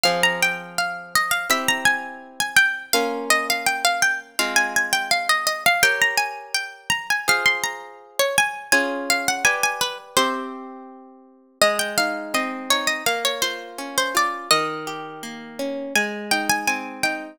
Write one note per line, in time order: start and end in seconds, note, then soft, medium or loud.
0.04 1.47 F3 medium
0.04 1.47 C4 medium
0.04 1.47 G#4 medium
0.04 0.21 F5 medium
0.23 0.41 A#5 medium
0.42 0.74 G5 medium
0.78 1.13 F5 medium
1.16 1.33 D#5 medium
1.31 1.48 F5 medium
1.50 2.91 C4 medium
1.50 2.91 E4 medium
1.50 2.91 G4 medium
1.50 1.68 E5 medium
1.68 1.86 A#5 medium
1.85 2.31 G#5 medium
2.40 2.57 G#5 medium
2.56 2.86 G5 medium
2.93 4.36 A#3 medium
2.93 4.36 C#4 medium
2.93 4.36 F4 medium
2.93 3.25 F5 medium
3.30 3.47 D#5 medium
3.50 3.67 F5 medium
3.66 3.84 G5 medium
3.85 4.02 F5 medium
4.02 4.19 G5 medium
4.39 5.81 G#3 medium
4.39 5.81 C4 medium
4.39 5.81 F4 medium
4.39 4.56 F5 medium
4.56 4.73 G#5 medium
4.76 4.93 G#5 medium
4.93 5.10 G5 medium
5.11 5.28 F5 medium
5.29 5.46 D#5 medium
5.47 5.64 D#5 medium
5.66 5.83 F5 medium
5.83 7.25 G4 medium
5.83 7.25 A#4 medium
5.83 7.25 C#5 medium
5.83 6.00 G5 medium
6.02 6.19 A#5 medium
6.17 6.53 G#5 medium
6.55 6.89 G5 medium
6.90 7.07 A#5 medium
7.10 7.27 G#5 medium
7.28 8.70 F4 medium
7.28 8.70 G#4 medium
7.28 8.70 C5 medium
7.28 7.46 F5 medium
7.46 7.63 C6 medium
7.64 8.09 A#5 medium
8.19 8.37 C#5 medium
8.38 8.72 G#5 medium
8.72 9.44 C#4 medium
8.72 9.44 F4 medium
8.72 9.44 G#4 medium
8.72 9.04 G#5 medium
9.10 9.27 F5 medium
9.28 9.45 F#5 medium
9.45 10.16 G4 medium
9.45 10.16 B4 medium
9.45 10.16 D5 medium
9.45 9.62 G#5 medium
9.63 9.81 G#5 medium
9.81 9.98 B4 medium
10.17 11.59 C4 medium
10.17 11.59 G4 loud
10.17 11.39 C5 medium
10.17 11.59 E5 medium
11.62 12.99 G#3 loud
11.62 11.79 D#5 medium
11.79 11.96 G5 medium
11.98 12.70 D#4 medium
11.98 12.33 F5 medium
12.34 13.03 C4 medium
12.34 12.70 D#5 medium
12.70 13.05 D#4 medium
12.70 12.88 C#5 medium
12.87 13.05 D#5 medium
13.06 14.44 A#3 medium
13.06 13.24 F5 medium
13.25 13.42 C#5 medium
13.42 14.14 F4 medium
13.42 13.89 C5 medium
13.78 14.47 C#4 medium
13.98 14.15 C5 medium
14.15 14.49 F4 medium
14.15 14.49 D5 medium
14.51 15.88 D#3 medium
14.51 15.75 D#5 medium
14.87 15.90 G4 medium
15.23 15.92 A#3 medium
15.59 15.94 C#4 medium
15.95 17.33 G#3 medium
15.95 16.25 G#5 medium
16.31 17.03 D#4 medium
16.31 16.48 G5 medium
16.50 16.67 G#5 medium
16.67 17.36 C4 medium
16.67 16.99 G#5 medium
17.03 17.38 D#4 medium
17.03 17.37 G5 medium